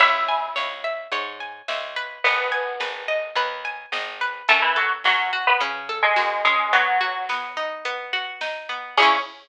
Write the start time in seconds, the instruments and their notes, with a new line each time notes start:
0.00 electric bass (finger) C#2, pizzicato strings E4 C#5 E5, kick, crash
0.29 pizzicato strings G#5
0.56 electric bass (finger) C#2, pizzicato strings C#5, snare
0.84 pizzicato strings E5
1.12 electric bass (finger) G#2, pizzicato strings C#5, closed hi-hat
1.40 pizzicato strings G#5
1.68 electric bass (finger) C#2, pizzicato strings E5, snare
1.96 pizzicato strings B4
2.24 electric bass (finger) G#1, pizzicato strings B3 B4, kick, closed hi-hat
2.52 pizzicato strings G#5
2.80 electric bass (finger) G#1, pizzicato strings B4, snare
3.08 pizzicato strings D#5
3.35 electric bass (finger) D#2, pizzicato strings B4, closed hi-hat
3.65 pizzicato strings G#5
3.92 electric bass (finger) G#1, pizzicato strings D#5, snare
4.21 pizzicato strings B4
4.48 electric bass (finger) F#2, pizzicato strings A3 C#4 A4, kick, closed hi-hat
4.62 pizzicato strings E3 E4
4.76 pizzicato strings F#3 F#4 A4
5.04 electric bass (finger) F#2, pizzicato strings F#3 C#4 F#4, snare
5.33 pizzicato strings F#4
5.47 pizzicato strings B3 B4
5.60 electric bass (finger) C#3, pizzicato strings C#4, closed hi-hat
5.89 pizzicato strings A4
6.02 pizzicato strings G#3 G#4
6.16 electric bass (finger) F#2, pizzicato strings F#4, snare
6.45 pizzicato strings G#3 C#4 G#4
6.73 pizzicato strings F#3 B3 F#4, kick, closed hi-hat
7.01 pizzicato strings F#4
7.29 pizzicato strings B3, snare
7.57 pizzicato strings D#4
7.85 pizzicato strings B3, closed hi-hat
8.13 pizzicato strings F#4
8.41 pizzicato strings D#4, snare
8.69 pizzicato strings B3
8.97 electric bass (finger) C#2, pizzicato strings C#4 E4 G#4, kick, crash
9.02 pizzicato strings C#4